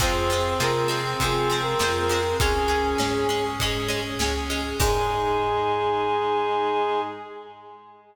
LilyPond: <<
  \new Staff \with { instrumentName = "Brass Section" } { \time 4/4 \key aes \major \tempo 4 = 100 c''4 bes'8 r8 \tuplet 3/2 { aes'4 bes'4 bes'4 } | aes'2 r2 | aes'1 | }
  \new Staff \with { instrumentName = "Clarinet" } { \time 4/4 \key aes \major c'1 | des'4. r2 r8 | aes1 | }
  \new Staff \with { instrumentName = "Acoustic Guitar (steel)" } { \time 4/4 \key aes \major <f aes c'>8 <f aes c'>8 <f aes c'>8 <f aes c'>8 <f aes c'>8 <f aes c'>8 <f aes c'>8 <f aes c'>8 | <aes des'>8 <aes des'>8 <aes des'>8 <aes des'>8 <aes des'>8 <aes des'>8 <aes des'>8 <aes des'>8 | <ees aes>1 | }
  \new Staff \with { instrumentName = "Drawbar Organ" } { \time 4/4 \key aes \major <c' f' aes'>4 <c' f' aes'>4 <c' f' aes'>4 <c' f' aes'>4 | <des' aes'>4 <des' aes'>4 <des' aes'>4 <des' aes'>4 | <ees' aes'>1 | }
  \new Staff \with { instrumentName = "Electric Bass (finger)" } { \clef bass \time 4/4 \key aes \major f,4 c4 c4 f,4 | des,4 aes,4 aes,4 des,4 | aes,1 | }
  \new Staff \with { instrumentName = "String Ensemble 1" } { \time 4/4 \key aes \major <c' f' aes'>1 | <des' aes'>1 | <ees' aes'>1 | }
  \new DrumStaff \with { instrumentName = "Drums" } \drummode { \time 4/4 <bd cymr>8 cymr8 sn8 cymr8 <bd cymr>8 cymr8 sn8 cymr8 | <bd cymr>8 cymr8 sn8 cymr8 <bd cymr>8 cymr8 sn8 cymr8 | <cymc bd>4 r4 r4 r4 | }
>>